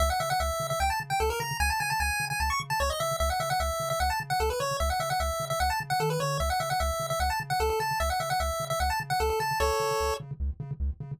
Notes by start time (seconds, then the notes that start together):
0.00 C#2 E5
0.10 F#5
0.20 C#3 E5
0.30 F#5
0.40 C#2 E5
0.60 C#3
0.70 E5
0.80 C#2 G5
0.90 A5
1.00 C#3
1.10 G5
1.20 C#2 A4
1.30 A#4
1.40 C#3 A#5
1.60 C#2 G#5
1.70 A5
1.80 C#3 G#5
1.90 A5
2.00 C#2 G#5
2.20 C#3
2.30 G#5
2.40 C#2 A5
2.50 C#6
2.60 C#3
2.70 A5
2.80 C#2 C#5
2.90 D#5
3.00 C#3 E5
3.20 C#2 E5
3.30 F#5
3.40 C#3 E5
3.50 F#5
3.60 C#2 E5
3.80 C#3
3.90 E5
4.00 C#2 F#5
4.10 A5
4.20 C#3
4.30 F#5
4.40 C#2 A4
4.50 B4
4.60 C#3 C#5
4.80 C#2 E5
4.90 F#5
5.00 C#3 E5
5.10 F#5
5.20 C#2 E5
5.40 C#3
5.50 E5
5.60 C#2 F#5
5.70 A5
5.80 C#3
5.90 F#5
6.00 D#3 A4
6.10 B4
6.20 D3 C#5
6.40 C#2 E5
6.50 F#5
6.60 C#3 E5
6.70 F#5
6.80 C#2 E5
7.00 C#3
7.10 E5
7.20 C#2 F#5
7.30 A5
7.40 C#3
7.50 F#5
7.60 C#2 A4
7.70 A4
7.80 C#3 A5
8.00 C#2 E5
8.10 F#5
8.20 C#3 E5
8.30 F#5
8.40 C#2 E5
8.60 C#3
8.70 E5
8.80 C#2 F#5
8.90 A5
9.00 C#3
9.10 F#5
9.20 C#2 A4
9.30 A4
9.40 C#3 A5
9.60 C#2 A4 C#5
9.80 C#3
10.00 C#2
10.20 C#3
10.40 C#2
10.60 C#3
10.80 C#2
11.00 C#3